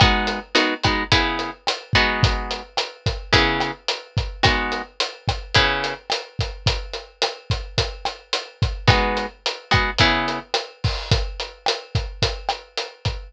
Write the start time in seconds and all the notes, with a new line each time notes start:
0.00 G#3 B3 D#4 F#4, kick, cross-stick, closed hi-hat
0.27 closed hi-hat
0.55 G#3 B3 D#4 F#4, closed hi-hat
0.83 G#3 B3 D#4 F#4, kick, cross-stick, closed hi-hat
1.12 C#3 B3 E4 G#4, kick, closed hi-hat
1.39 closed hi-hat
1.67 cross-stick, closed hi-hat
1.93 G#3 B3 D#4 F#4, kick, closed hi-hat
2.23 kick, closed hi-hat
2.51 closed hi-hat
2.77 cross-stick, closed hi-hat
3.06 kick, closed hi-hat
3.33 C#3 B3 E4 G#4, kick, closed hi-hat
3.60 cross-stick, closed hi-hat
3.88 closed hi-hat
4.17 kick, closed hi-hat
4.43 G#3 B3 D#4 F#4, kick, cross-stick, closed hi-hat
4.72 closed hi-hat
5.00 closed hi-hat
5.28 kick, cross-stick, closed hi-hat
5.55 C#3 B3 E4 G#4, kick, closed hi-hat
5.84 closed hi-hat
6.10 cross-stick, closed hi-hat
6.39 kick, closed hi-hat
6.66 kick, closed hi-hat
6.94 closed hi-hat
7.22 cross-stick, closed hi-hat
7.50 kick, closed hi-hat
7.78 kick, closed hi-hat
8.05 cross-stick, closed hi-hat
8.33 closed hi-hat
8.62 kick, closed hi-hat
8.88 G#3 B3 D#4 F#4, kick, cross-stick, closed hi-hat
9.17 closed hi-hat
9.46 closed hi-hat
9.71 G#3 B3 D#4 F#4, kick, cross-stick, closed hi-hat
9.98 C#3 B3 E4 G#4, kick, closed hi-hat
10.28 closed hi-hat
10.54 cross-stick, closed hi-hat
10.84 kick, open hi-hat
11.11 kick, closed hi-hat
11.40 closed hi-hat
11.66 cross-stick, closed hi-hat
11.95 kick, closed hi-hat
12.22 kick, closed hi-hat
12.49 cross-stick, closed hi-hat
12.77 closed hi-hat
13.05 kick, closed hi-hat